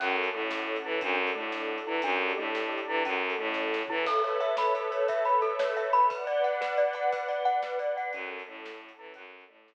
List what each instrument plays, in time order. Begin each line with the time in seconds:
0.00 violin F#2, glockenspiel C#4, string ensemble 1 C#4 F#4 A4, kick, crash
0.24 closed hi-hat
0.34 violin A2, glockenspiel A3
0.51 snare
0.76 closed hi-hat
0.84 violin E3, glockenspiel E4
1.01 violin F#2, glockenspiel D4, string ensemble 1 D4 F#4 A4, kick, closed hi-hat
1.27 closed hi-hat
1.35 violin A2, glockenspiel A3
1.52 snare
1.78 closed hi-hat
1.87 violin E3, glockenspiel E4
2.02 violin F#2, string ensemble 1 D4 G4 A4, glockenspiel D4, kick, closed hi-hat
2.30 closed hi-hat
2.37 violin A2, glockenspiel A3
2.55 snare
2.78 closed hi-hat
2.88 violin E3, glockenspiel E4
3.05 violin F#2, string ensemble 1 C#4 F#4 A4, glockenspiel C#4, kick, closed hi-hat
3.30 closed hi-hat
3.38 violin A2, glockenspiel A3
3.54 kick, snare
3.74 snare
3.88 violin E3, glockenspiel E4, floor tom
4.06 string ensemble 1 A4 B4 C#5 E5, glockenspiel A4, kick, crash
4.24 glockenspiel C#5, closed hi-hat
4.40 glockenspiel E5, closed hi-hat
4.57 glockenspiel B5, snare
4.75 glockenspiel A4, closed hi-hat
4.91 glockenspiel C#5, closed hi-hat
5.08 glockenspiel E5, kick, closed hi-hat
5.25 glockenspiel B5, closed hi-hat
5.42 glockenspiel A4, closed hi-hat
5.59 glockenspiel C#5, snare
5.77 glockenspiel E5, closed hi-hat
5.93 glockenspiel B5, closed hi-hat
6.10 glockenspiel B4, string ensemble 1 B4 D5 F#5, kick, closed hi-hat
6.27 glockenspiel D5, closed hi-hat
6.44 glockenspiel F#5, closed hi-hat
6.61 glockenspiel B4, snare
6.77 glockenspiel D5, closed hi-hat
6.93 glockenspiel F#5, closed hi-hat
7.12 glockenspiel B4, kick, closed hi-hat
7.28 glockenspiel D5, closed hi-hat
7.45 glockenspiel F#5, closed hi-hat
7.62 glockenspiel B4, snare
7.79 glockenspiel D5, closed hi-hat
7.97 glockenspiel F#5, closed hi-hat
8.13 violin F#2, glockenspiel C#4, string ensemble 1 C#4 F#4 A4, kick, closed hi-hat
8.39 closed hi-hat
8.48 violin A2, glockenspiel A3
8.66 snare
8.89 closed hi-hat
8.99 violin E3, glockenspiel E4
9.14 violin F#2, glockenspiel C#4, string ensemble 1 C#4 F#4 A4, kick, closed hi-hat
9.40 closed hi-hat
9.49 violin A2, glockenspiel A3
9.68 snare